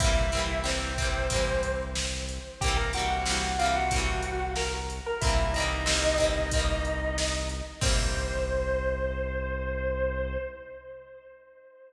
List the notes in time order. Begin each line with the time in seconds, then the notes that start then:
0.00 C2 A#3 C4 E4 E5, kick, closed hi-hat
0.04 E3 G3
0.32 A#3 C4, closed hi-hat
0.37 E3 G3
0.64 G3 A#3 C4 C5, snare
0.70 E3
0.98 G3 A#3 C4, kick, closed hi-hat
1.04 E3
1.30 A#3 C4, kick, closed hi-hat
1.34 E3 G3
1.63 closed hi-hat
1.96 snare
2.29 closed hi-hat
2.61 C2 A#3 C4 G4 G5, kick, closed hi-hat
2.66 E3 G3
2.76 A#4 A#5
2.93 A#3 C4 F#4 F#5, closed hi-hat
2.97 E3 G3
3.10 F#4 F#5
3.26 G3 A#3 C4, snare
3.31 E3
3.59 A#3 C4 F4 F5, closed hi-hat
3.63 E3 G3
3.75 F#4 F#5
3.91 A#3 C4, kick, closed hi-hat
3.96 E3 G3
4.23 closed hi-hat
4.56 A#4 A#5, snare
4.90 closed hi-hat
5.06 A#4 A#5
5.21 C2 A#3 C4 E4 E5, kick, closed hi-hat
5.27 E3 G3
5.53 C4 D#4 D#5, closed hi-hat
5.58 E3 G3 A#3
5.86 G3 A#3 C4, snare
5.92 E3
6.18 G3 A#3 C4, kick, closed hi-hat
6.24 E3
6.51 A#3 C4, kick, closed hi-hat
6.57 E3 G3
6.85 closed hi-hat
7.18 snare
7.49 closed hi-hat
7.81 C2 G3 A#3 C4 C5, kick, crash
7.87 E3